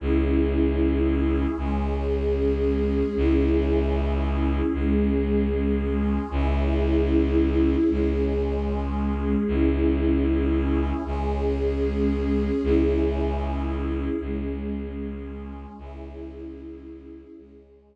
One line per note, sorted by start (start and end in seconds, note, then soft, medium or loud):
0.00 1.46 C#2 loud
0.00 1.56 C#4 medium
0.00 1.56 E4 medium
0.00 1.56 G#4 medium
1.58 3.03 C#2 loud
1.58 3.15 G#3 medium
1.58 3.15 C#4 medium
1.58 3.15 G#4 medium
3.16 4.62 C#2 loud
3.16 4.73 C#4 medium
3.16 4.73 E4 medium
3.16 4.73 G#4 medium
4.74 6.19 C#2 loud
4.74 6.30 G#3 medium
4.74 6.30 C#4 medium
4.74 6.30 G#4 medium
6.31 7.76 C#2 loud
6.31 7.88 C#4 medium
6.31 7.88 E4 medium
6.31 7.88 G#4 medium
7.89 9.36 C#2 medium
7.89 9.45 G#3 medium
7.89 9.45 C#4 medium
7.89 9.45 G#4 medium
9.47 10.93 C#2 loud
9.47 11.03 C#4 medium
9.47 11.03 E4 medium
9.47 11.03 G#4 medium
11.05 12.51 C#2 medium
11.05 12.62 G#3 medium
11.05 12.62 C#4 medium
11.05 12.62 G#4 medium
12.63 14.09 C#2 loud
12.63 14.20 C#4 medium
12.63 14.20 E4 medium
12.63 14.20 G#4 medium
14.21 15.66 C#2 medium
14.21 15.78 G#3 medium
14.21 15.78 C#4 medium
14.21 15.78 G#4 medium
15.78 17.24 C#2 loud
15.78 17.35 C#4 medium
15.78 17.35 E4 medium
15.78 17.35 G#4 medium
17.37 17.96 C#2 medium
17.37 17.96 G#3 medium
17.37 17.96 C#4 medium
17.37 17.96 G#4 medium